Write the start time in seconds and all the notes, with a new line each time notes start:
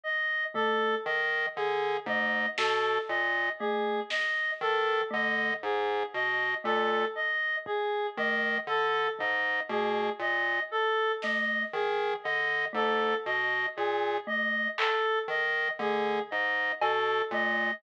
0.04 D#5
0.54 A3 A4, floor tom
1.05 D#3 D#5
1.56 D3 G#4
2.06 G#2 A3 D#5, floor tom
2.58 B2 A4, snare
3.09 A#2 D#5
3.60 A3 G#4
4.10 D#5, snare
4.61 D#3 A4
5.11 D3 A3 D#5
5.63 G#2 G#4
6.14 B2 D#5
6.64 A#2 A3 A4
7.15 D#5
7.66 G#4, kick
8.17 D#3 A3 D#5
8.67 D3 A4
9.19 G#2 D#5, floor tom
9.69 B2 A3 G#4
10.19 A#2 D#5
10.71 A4
11.22 A3 D#5, snare
11.73 D#3 G#4
12.24 D3 D#5
12.73 G#2 A3 A4
13.26 B2 D#5
13.76 A#2 G#4
14.27 A3 D#5
14.78 A4, clap
15.28 D#3 D#5
15.79 D3 A3 G#4
16.31 G#2 D#5
16.82 B2 A4, cowbell
17.31 A#2 A3 D#5